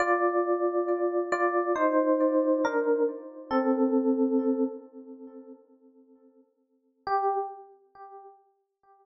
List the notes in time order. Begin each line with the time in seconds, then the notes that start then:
0.00 F4 D5
1.32 F4 D5
1.76 D#4 C5
2.65 D4 A#4
3.51 C4 A4
7.07 G4